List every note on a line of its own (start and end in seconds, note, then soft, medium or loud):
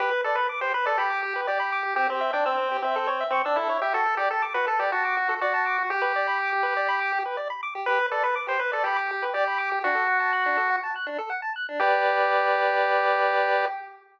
0.00 0.10 G4 loud
0.00 0.21 B4 medium
0.11 0.22 B4 medium
0.24 0.36 A4 medium
0.24 0.36 D5 medium
0.35 0.47 B4 medium
0.35 0.48 B5 medium
0.49 0.60 D6 medium
0.61 0.72 G4 medium
0.61 0.73 C5 medium
0.74 0.86 B4 medium
0.74 0.85 B4 medium
0.86 0.98 A4 medium
0.86 0.97 D5 medium
0.98 1.41 G4 medium
0.98 1.10 B5 medium
1.10 1.21 D6 medium
1.23 1.34 G4 medium
1.36 1.47 B4 medium
1.47 1.95 G4 medium
1.47 1.58 D5 medium
1.60 1.71 B5 medium
1.72 1.83 D6 medium
1.83 1.94 G4 medium
1.96 2.07 C4 loud
1.96 2.08 G4 medium
2.09 2.31 C4 medium
2.09 2.20 G4 medium
2.21 2.32 E5 medium
2.33 2.45 D4 medium
2.33 2.44 G5 medium
2.45 2.77 C4 medium
2.45 2.57 E6 medium
2.57 2.69 C4 medium
2.71 2.82 G4 medium
2.82 3.24 C4 medium
2.82 2.95 E5 medium
2.96 3.07 A4 loud
3.07 3.18 C#5 medium
3.20 3.32 E5 medium
3.30 3.42 C4 medium
3.30 3.43 C#6 medium
3.45 3.57 D4 medium
3.45 3.56 E6 medium
3.56 3.78 E4 medium
3.56 3.68 A4 medium
3.69 3.80 C#5 medium
3.82 3.93 G4 medium
3.82 3.93 E5 medium
3.93 4.04 F#4 medium
3.93 4.15 A4 medium
4.06 4.17 A4 medium
4.17 4.29 G4 medium
4.17 4.29 D5 medium
4.31 4.42 A4 medium
4.31 4.43 A5 medium
4.42 4.53 D6 medium
4.54 4.66 F#4 medium
4.54 4.66 B4 medium
4.67 4.78 A4 medium
4.67 4.80 A4 medium
4.79 4.91 G4 medium
4.79 4.90 D5 medium
4.92 5.34 F#4 medium
4.92 5.03 A5 medium
5.05 5.16 D6 medium
5.17 5.28 F#4 medium
5.29 5.40 A4 medium
5.41 5.83 F#4 medium
5.41 5.53 D5 medium
5.54 5.65 A5 medium
5.66 5.77 D6 medium
5.78 5.89 F#4 medium
5.90 7.19 G4 medium
5.90 6.02 G4 loud
6.02 6.13 B4 medium
6.16 6.27 D5 medium
6.27 6.38 B5 medium
6.39 6.50 D6 medium
6.53 6.64 G4 medium
6.63 6.74 B4 medium
6.77 6.88 D5 medium
6.89 7.00 B5 loud
7.00 7.11 D6 medium
7.12 7.23 G4 medium
7.26 7.37 B4 medium
7.37 7.48 D5 medium
7.50 7.61 B5 medium
7.63 7.74 D6 medium
7.75 7.86 G4 medium
7.86 7.99 G4 loud
7.86 8.06 B4 loud
7.99 8.10 B4 medium
8.11 8.23 A4 medium
8.11 8.23 D5 medium
8.23 8.35 B4 medium
8.23 8.35 B5 medium
8.36 8.47 D6 medium
8.47 8.58 G4 medium
8.47 8.60 C5 medium
8.59 8.71 B4 medium
8.59 8.72 B4 medium
8.72 8.85 A4 medium
8.72 8.83 D5 medium
8.84 9.25 G4 medium
8.84 8.97 B5 loud
8.96 9.07 D6 medium
9.11 9.22 G4 medium
9.22 9.33 B4 medium
9.34 9.79 G4 medium
9.34 9.45 D5 loud
9.47 9.58 B5 medium
9.58 9.69 D6 medium
9.72 9.83 G4 medium
9.84 9.95 D4 medium
9.84 10.76 F#4 loud
9.95 10.06 A4 medium
10.08 10.19 F#5 medium
10.20 10.31 A5 medium
10.33 10.44 F#6 medium
10.46 10.57 D4 medium
10.57 10.68 A4 medium
10.70 10.81 F#5 medium
10.83 10.94 A5 medium
10.96 11.07 F#6 medium
11.07 11.18 D4 medium
11.18 11.30 A4 medium
11.30 11.41 F#5 medium
11.42 11.53 A5 medium
11.56 11.67 F#6 medium
11.69 11.80 D4 medium
11.80 13.65 G4 loud
11.80 13.66 G4 medium
11.80 13.66 B4 loud
11.80 13.66 D5 loud